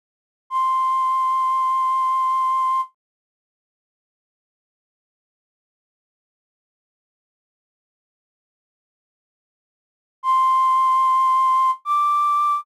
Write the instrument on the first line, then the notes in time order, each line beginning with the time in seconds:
flute
0.50 C6
10.23 C6
11.85 D6